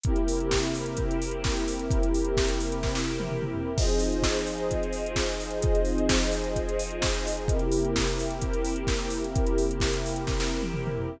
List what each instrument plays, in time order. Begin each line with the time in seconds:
0.03 pad 2 (warm) C3 A#3 C4 E4 G4 A#4, kick, closed hi-hat
0.16 closed hi-hat
0.28 open hi-hat
0.40 closed hi-hat
0.51 kick, snare
0.63 closed hi-hat
0.74 open hi-hat
0.86 closed hi-hat
0.97 kick, closed hi-hat
1.11 closed hi-hat
1.22 open hi-hat
1.31 closed hi-hat
1.44 kick, snare
1.57 closed hi-hat
1.68 open hi-hat
1.79 closed hi-hat
1.91 kick, closed hi-hat
2.03 closed hi-hat
2.14 open hi-hat
2.24 closed hi-hat
2.37 kick, snare
2.48 closed hi-hat
2.60 open hi-hat
2.72 closed hi-hat
2.83 kick, snare
2.95 snare
3.20 high tom
3.29 mid tom
3.42 mid tom
3.54 floor tom
3.77 pad 2 (warm) F3 C4 D#4 F4 G#4 C5 D#5, kick, crash
3.89 closed hi-hat
3.99 open hi-hat
4.12 closed hi-hat
4.22 kick, snare
4.34 closed hi-hat
4.46 open hi-hat
4.58 closed hi-hat
4.71 kick, closed hi-hat
4.83 closed hi-hat
4.93 open hi-hat
5.06 closed hi-hat
5.16 kick, snare
5.29 closed hi-hat
5.40 open hi-hat
5.50 closed hi-hat
5.62 kick, closed hi-hat
5.75 closed hi-hat
5.85 open hi-hat
5.98 closed hi-hat
6.09 kick, snare
6.20 closed hi-hat
6.31 open hi-hat
6.44 closed hi-hat
6.56 kick, closed hi-hat
6.69 closed hi-hat
6.79 open hi-hat
6.91 closed hi-hat
7.02 kick, snare
7.14 closed hi-hat
7.27 open hi-hat
7.37 closed hi-hat
7.48 pad 2 (warm) C3 A#3 C4 E4 G4 A#4, kick, closed hi-hat
7.59 closed hi-hat
7.72 open hi-hat
7.84 closed hi-hat
7.96 kick, snare
8.08 closed hi-hat
8.19 open hi-hat
8.30 closed hi-hat
8.41 kick, closed hi-hat
8.53 closed hi-hat
8.65 open hi-hat
8.76 closed hi-hat
8.87 kick, snare
8.99 closed hi-hat
9.10 open hi-hat
9.24 closed hi-hat
9.35 kick, closed hi-hat
9.46 closed hi-hat
9.58 open hi-hat
9.71 closed hi-hat
9.80 kick, snare
9.93 closed hi-hat
10.06 open hi-hat
10.16 closed hi-hat
10.27 kick, snare
10.40 snare
10.62 high tom
10.74 mid tom
10.87 mid tom
10.98 floor tom